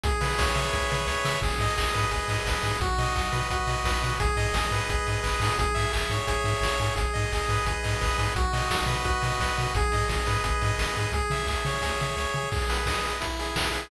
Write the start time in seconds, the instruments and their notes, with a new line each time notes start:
0.03 synth bass 1 C#2, lead 1 (square) G#4, kick, closed hi-hat
0.21 synth bass 1 C#3, lead 1 (square) B4, open hi-hat
0.38 synth bass 1 C#2, lead 1 (square) C#5, kick, snare
0.55 synth bass 1 C#3, lead 1 (square) E5, open hi-hat
0.73 synth bass 1 C#2, lead 1 (square) G#4, kick, snare
0.90 synth bass 1 C#3, lead 1 (square) B4, snare
1.07 synth bass 1 C#2, lead 1 (square) C#5, snare
1.25 synth bass 1 C#3, lead 1 (square) E5, snare
1.42 synth bass 1 G#1, lead 1 (square) G#4, kick, crash
1.59 synth bass 1 G#2, lead 1 (square) D#5, open hi-hat
1.76 synth bass 1 G#1, lead 1 (square) G#4, kick, clap
1.94 synth bass 1 G#2, lead 1 (square) B4, open hi-hat
2.11 synth bass 1 G#1, lead 1 (square) G#4, kick, closed hi-hat
2.28 synth bass 1 G#2, lead 1 (square) D#5, open hi-hat
2.45 synth bass 1 G#1, lead 1 (square) B4, kick, snare
2.63 synth bass 1 G#2, lead 1 (square) G#4, open hi-hat
2.81 synth bass 1 B1, lead 1 (square) F#4, kick, closed hi-hat
2.98 synth bass 1 B2, lead 1 (square) D#5, open hi-hat
3.16 synth bass 1 B1, lead 1 (square) F#4, kick, clap
3.32 synth bass 1 B2, lead 1 (square) B4, open hi-hat
3.50 synth bass 1 B1, lead 1 (square) F#4, kick, closed hi-hat
3.67 synth bass 1 B2, lead 1 (square) D#5, open hi-hat
3.84 synth bass 1 B1, lead 1 (square) B4, kick, snare
4.02 synth bass 1 B2, lead 1 (square) F#4, open hi-hat
4.20 synth bass 1 G#1, lead 1 (square) G#4, kick, closed hi-hat
4.37 synth bass 1 G#2, lead 1 (square) D#5, open hi-hat
4.53 synth bass 1 G#1, lead 1 (square) G#4, kick, snare
4.71 synth bass 1 G#2, lead 1 (square) B4, open hi-hat
4.89 synth bass 1 G#1, lead 1 (square) G#4, kick, closed hi-hat
5.07 synth bass 1 G#2, lead 1 (square) D#5, open hi-hat
5.23 synth bass 1 G#1, lead 1 (square) B4, kick, clap
5.40 synth bass 1 G#2, lead 1 (square) G#4, open hi-hat
5.58 synth bass 1 G#1, lead 1 (square) G#4, kick, closed hi-hat
5.75 synth bass 1 G#2, lead 1 (square) E5, open hi-hat
5.93 synth bass 1 G#1, lead 1 (square) G#4, kick, clap
6.10 synth bass 1 G#2, lead 1 (square) C#5, open hi-hat
6.27 synth bass 1 G#1, lead 1 (square) G#4, kick, closed hi-hat
6.44 synth bass 1 G#2, lead 1 (square) E5, open hi-hat
6.61 synth bass 1 G#1, lead 1 (square) C#5, kick, snare
6.79 synth bass 1 G#2, lead 1 (square) G#4, open hi-hat
6.96 synth bass 1 G#1, lead 1 (square) G#4, kick, closed hi-hat
7.14 synth bass 1 G#2, lead 1 (square) D#5, open hi-hat
7.32 synth bass 1 G#1, lead 1 (square) G#4, kick, clap
7.48 synth bass 1 G#2, lead 1 (square) B4, open hi-hat
7.65 synth bass 1 G#1, lead 1 (square) G#4, kick, closed hi-hat
7.84 synth bass 1 G#2, lead 1 (square) D#5, open hi-hat
8.01 synth bass 1 G#1, lead 1 (square) B4, kick, clap
8.18 synth bass 1 G#2, lead 1 (square) G#4, open hi-hat
8.35 synth bass 1 B1, lead 1 (square) F#4, kick, closed hi-hat
8.53 synth bass 1 B2, lead 1 (square) D#5, open hi-hat
8.70 synth bass 1 B1, lead 1 (square) F#4, kick, snare
8.86 synth bass 1 B2, lead 1 (square) B4, open hi-hat
9.05 synth bass 1 B1, lead 1 (square) F#4, kick, closed hi-hat
9.22 synth bass 1 B2, lead 1 (square) D#5, open hi-hat
9.40 synth bass 1 B1, lead 1 (square) B4, kick, snare
9.57 synth bass 1 B2, lead 1 (square) F#4, open hi-hat
9.74 synth bass 1 G#1, lead 1 (square) G#4, kick, closed hi-hat
9.92 synth bass 1 G#2, lead 1 (square) D#5, open hi-hat
10.09 synth bass 1 G#1, lead 1 (square) G#4, kick, snare
10.26 synth bass 1 G#2, lead 1 (square) B4, open hi-hat
10.44 synth bass 1 G#1, lead 1 (square) G#4, kick, closed hi-hat
10.61 synth bass 1 G#2, lead 1 (square) D#5, open hi-hat
10.78 synth bass 1 G#1, lead 1 (square) B4, kick, snare
10.96 synth bass 1 G#2, lead 1 (square) G#4, open hi-hat
11.12 synth bass 1 C#2, lead 1 (square) G#4, kick, closed hi-hat
11.30 synth bass 1 C#3, lead 1 (square) E5, open hi-hat
11.47 synth bass 1 C#2, lead 1 (square) G#4, kick, clap
11.65 synth bass 1 C#3, lead 1 (square) C#5, open hi-hat
11.82 synth bass 1 C#2, lead 1 (square) G#4, kick, snare
12.00 synth bass 1 C#3, lead 1 (square) E5, snare
12.17 synth bass 1 C#2, lead 1 (square) C#5, snare
12.34 synth bass 1 C#3, lead 1 (square) G#4
12.52 lead 1 (square) G#4, kick, crash
12.62 closed hi-hat
12.69 lead 1 (square) B4, open hi-hat
12.78 closed hi-hat
12.86 lead 1 (square) D#5, kick, snare
12.95 closed hi-hat
13.03 lead 1 (square) B4, open hi-hat
13.13 closed hi-hat
13.21 lead 1 (square) E4, kick, closed hi-hat
13.30 closed hi-hat
13.39 lead 1 (square) G#4, open hi-hat
13.48 closed hi-hat
13.56 lead 1 (square) B4, kick, snare
13.65 closed hi-hat
13.72 lead 1 (square) G#4, open hi-hat
13.82 closed hi-hat